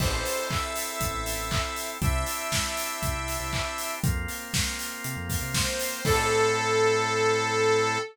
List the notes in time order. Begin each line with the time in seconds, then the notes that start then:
0.00 A1 C4 E4 A4 C5, kick, crash
0.25 open hi-hat
0.51 E5, kick, clap
0.76 open hi-hat
1.00 A1, kick, closed hi-hat
1.13 A1
1.26 open hi-hat
1.38 A1
1.51 kick, clap
1.76 open hi-hat
2.01 C2 C4 D4 E4 G4 E5, kick, closed hi-hat
2.26 open hi-hat
2.52 kick, snare
2.77 open hi-hat
3.03 C2, kick, closed hi-hat
3.15 C2
3.28 open hi-hat
3.40 C2
3.53 kick, clap
3.78 open hi-hat
4.04 F2 A#3 C4 F4, kick, closed hi-hat
4.28 open hi-hat
4.54 kick, snare
4.79 open hi-hat
5.04 C3, closed hi-hat
5.17 F2
5.29 kick, open hi-hat
5.42 C3
5.54 C5, kick, snare
5.79 open hi-hat
6.05 A2 C4 E4 A4, kick, crash